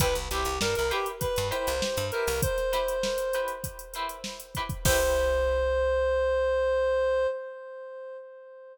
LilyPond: <<
  \new Staff \with { instrumentName = "Clarinet" } { \time 4/4 \key c \mixolydian \tempo 4 = 99 b'16 r16 g'8 bes'16 bes'16 g'16 r16 b'8 c''4 bes'8 | c''2 r2 | c''1 | }
  \new Staff \with { instrumentName = "Acoustic Guitar (steel)" } { \time 4/4 \key c \mixolydian <e' g' b' c''>8 <e' g' b' c''>4 <e' g' b' c''>4 <e' g' b' c''>4 <e' g' b' c''>8~ | <e' g' b' c''>8 <e' g' b' c''>4 <e' g' b' c''>4 <e' g' b' c''>4 <e' g' b' c''>8 | <e' g' b' c''>1 | }
  \new Staff \with { instrumentName = "Electric Bass (finger)" } { \clef bass \time 4/4 \key c \mixolydian c,16 c,16 c,16 c,16 g,16 c,4 g,8 c,8 g,8 c,16~ | c,1 | c,1 | }
  \new DrumStaff \with { instrumentName = "Drums" } \drummode { \time 4/4 <hh bd>16 hh16 hh16 hh16 sn16 hh16 hh16 hh16 <hh bd>16 hh16 hh16 hh16 sn16 hh16 hh16 hho16 | <hh bd>16 <hh sn>16 <hh sn>16 hh16 sn16 hh16 hh16 hh16 <hh bd>16 hh16 hh16 hh16 sn16 hh16 <hh bd>16 <hh bd>16 | <cymc bd>4 r4 r4 r4 | }
>>